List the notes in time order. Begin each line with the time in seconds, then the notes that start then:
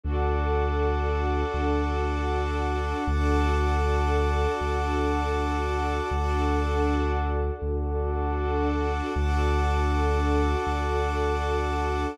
0.03 D2 D4 F#4 A4 F#5 A5 D6
1.54 D2
3.07 D2 D4 F#4 A4 F#5 A5 D6
4.61 D2
6.11 D2 D4 F#4 A4 F#5 A5 D6
7.62 D2
9.15 D2 D4 F#4 A4 F#5 A5 D6
10.67 D2